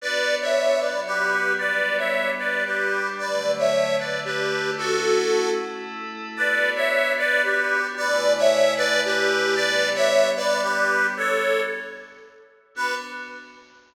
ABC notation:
X:1
M:3/4
L:1/16
Q:1/4=113
K:Bm
V:1 name="Accordion"
[Bd]3 [ce]3 [Bd]2 [GB]4 | [Bd]3 [ce]3 [Bd]2 [GB]4 | [Bd]3 [ce]3 [Bd]2 [GB]4 | [FA]6 z6 |
[Bd]3 [ce]3 [Bd]2 [GB]4 | [Bd]3 [ce]3 [Bd]2 [GB]4 | [Bd]3 [ce]3 [Bd]2 [GB]4 | [Ac]4 z8 |
B4 z8 |]
V:2 name="Pad 5 (bowed)"
[B,DF]6 [F,B,F]6 | [G,B,D]6 [G,DG]6 | [D,F,A,]6 [D,A,D]6 | [A,CE]6 [A,EA]6 |
[B,DF]12 | [C,A,E]12 | [G,B,D]12 | z12 |
[B,DF]4 z8 |]